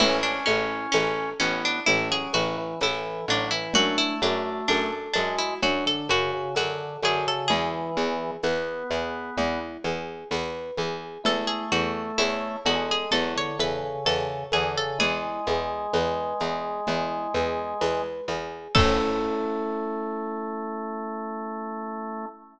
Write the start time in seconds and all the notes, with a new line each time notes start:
0.00 A1 C#4 E4, crash, low conga, shaker
0.23 D4
0.46 A1 C#4 E4, high conga, shaker
0.92 A1 C#4 A4, tambourine, high conga, shaker
1.40 A1 B3 C#4 E4, shaker
1.65 D4
1.86 A1 A3 C#4 E4, low conga, shaker
2.11 F#3 G#4
2.33 A1 E3 E4 F#4, high conga, shaker
2.58 E3
2.81 A1 E3 E4 A4, tambourine, high conga, shaker
3.28 A1 F#3 D4 E4, shaker
3.51 E3 E4
3.73 F#2 A3 D4 F#4, low conga, shaker
3.98 E4
4.22 F#2 D4 F#4, high conga, shaker
4.68 F#2 D4 A4, tambourine, high conga, shaker
5.13 F#2 G#3 D4 F#4, high conga, shaker
5.38 E4
5.62 F#2 F#3 D4 F#4, low conga, shaker
5.86 D3 A4
6.09 F#2 C#3 F#4, high conga, shaker
6.33 C#3
6.55 F#2 D3 F#4 A4, tambourine, high conga, shaker
7.03 F#2 D3 F#4 G#4, high conga, shaker
7.27 C#3 A4
7.48 E2 E3 E4 G#4, low conga, shaker
7.97 E2 G#4, shaker
8.43 E2 B3 B4, tambourine, high conga, shaker
8.90 E2 G#4, shaker
9.37 E2 E4, low conga, shaker
9.84 E2 G#4, high conga, shaker
10.31 E2 B4, tambourine, high conga, shaker
10.77 E2 G#4, high conga, shaker
11.24 E2 A3 E4 A4, low conga, shaker
11.47 G#4
11.72 E2 F#4 A4, shaker
12.18 E2 E4 C#5, tambourine, high conga, shaker
12.65 E2 G#3 F#4 A4, high conga, shaker
12.91 G#4
13.11 E2 F#3 E4 A4, low conga, shaker
13.36 D3 C#5
13.59 E2 C#3 A4 B4, high conga, shaker
13.83 C#3
14.05 E2 C#3 A4 C#5, tambourine, high conga, shaker
14.52 E2 D3 G#4 A4, high conga, shaker
14.77 C#3 A4
14.99 E2 G#3 E4 G#4, low conga, shaker
15.46 E2 G#4, high conga, shaker
15.93 E2 B4, tambourine, high conga, shaker
16.40 E2 G#4, shaker
16.87 E2 E4, low conga, shaker
17.34 E2 G#4, high conga, shaker
17.81 E2 B4, tambourine, high conga, shaker
18.28 E2 G#4, high conga, shaker
18.75 A2 A3 C#4 E4 A4, kick, crash